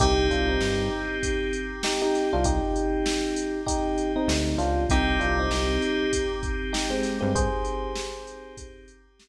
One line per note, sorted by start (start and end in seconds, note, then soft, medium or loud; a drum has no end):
0.00 0.29 C2 loud
0.00 4.82 C4 medium
0.00 0.27 D#4 loud
0.00 4.82 D#4 medium
0.00 0.27 G4 loud
0.00 4.82 G4 medium
0.00 kick loud
0.00 closed hi-hat medium
0.30 0.59 C2 loud
0.30 0.48 D4 medium
0.30 0.48 F4 loud
0.30 kick medium
0.30 closed hi-hat medium
0.48 1.18 C4 medium
0.48 1.18 D#4 loud
0.61 0.89 G2 loud
0.61 snare loud
1.23 kick medium
1.23 closed hi-hat medium
1.53 closed hi-hat medium
1.83 2.01 D#4 medium
1.83 2.01 G4 medium
1.83 snare loud
2.02 2.29 D#4 loud
2.02 2.29 G4 loud
2.14 snare medium
2.14 closed hi-hat medium
2.33 2.60 C2 loud
2.33 2.45 D4 loud
2.33 2.45 F4 loud
2.44 3.60 D#4 loud
2.44 3.60 G4 loud
2.44 kick loud
2.44 closed hi-hat loud
2.76 closed hi-hat medium
3.06 snare loud
3.36 closed hi-hat medium
3.66 4.12 D#4 loud
3.66 4.12 G4 loud
3.66 kick medium
3.66 closed hi-hat loud
3.98 closed hi-hat medium
4.16 4.57 C4 medium
4.16 4.57 D#4 loud
4.28 4.56 D2 loud
4.28 snare loud
4.58 4.86 C#2 medium
4.58 4.84 D4 loud
4.58 4.84 F4 loud
4.58 snare medium
4.58 closed hi-hat medium
4.89 5.18 C2 loud
4.89 9.28 C4 medium
4.89 9.28 D#4 medium
4.89 5.19 D#4 loud
4.89 9.28 G4 medium
4.89 5.19 G4 loud
4.89 kick loud
4.89 closed hi-hat loud
5.20 5.49 C2 loud
5.20 5.37 D4 medium
5.20 5.37 F4 loud
5.20 closed hi-hat medium
5.39 6.12 C4 loud
5.39 6.12 D#4 loud
5.50 5.79 C2 loud
5.50 snare loud
5.82 closed hi-hat medium
6.13 kick medium
6.13 closed hi-hat loud
6.43 kick medium
6.43 closed hi-hat medium
6.73 6.90 D#4 medium
6.73 6.90 G4 medium
6.73 snare loud
6.90 7.18 G#3 loud
6.90 7.18 C4 loud
7.03 snare medium
7.03 closed hi-hat medium
7.21 7.49 G2 loud
7.21 7.32 G#3 loud
7.21 7.32 C4 loud
7.35 8.55 G#4 loud
7.35 8.55 C5 loud
7.35 kick loud
7.35 closed hi-hat loud
7.65 closed hi-hat medium
7.96 snare loud
8.27 closed hi-hat medium
8.57 kick medium
8.57 closed hi-hat loud
8.88 closed hi-hat medium
9.20 snare loud